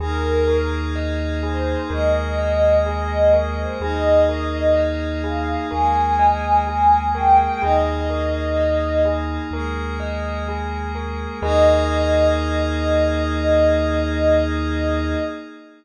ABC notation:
X:1
M:4/4
L:1/16
Q:1/4=63
K:Ebmix
V:1 name="Pad 5 (bowed)"
B4 z2 c2 e4 e2 e c | e4 z2 f2 a4 a2 g g | e6 z10 | e16 |]
V:2 name="Tubular Bells"
A2 B2 e2 A2 B2 e2 A2 B2 | A2 B2 e2 A2 B2 e2 A2 B2 | A2 B2 e2 A2 B2 e2 A2 B2 | [ABe]16 |]
V:3 name="Synth Bass 2" clef=bass
E,,8 E,,8 | E,,8 E,,8 | E,,8 E,,8 | E,,16 |]
V:4 name="Pad 5 (bowed)"
[B,EA]8 [A,B,A]8 | [B,EA]8 [A,B,A]8 | [B,EA]8 [A,B,A]8 | [B,EA]16 |]